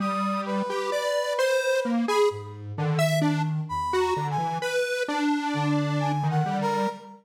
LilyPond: <<
  \new Staff \with { instrumentName = "Lead 1 (square)" } { \time 5/8 \tempo 4 = 65 g8. g'16 d''8 c''8 bes16 aes'16 | r8 d16 e''16 d'16 r8 ges'16 d16 e16 | b'8 d'4~ d'16 ees16 g8 | }
  \new Staff \with { instrumentName = "Brass Section" } { \time 5/8 ees'''8 b'4.~ b'16 b''16 | r4. \tuplet 3/2 { b''8 bes''8 aes''8 } | r4. \tuplet 3/2 { aes''8 ges''8 bes'8 } | }
  \new Staff \with { instrumentName = "Ocarina" } { \clef bass \time 5/8 r2 r8 | aes,8 ees4 e,8 r8 | r4 d4. | }
>>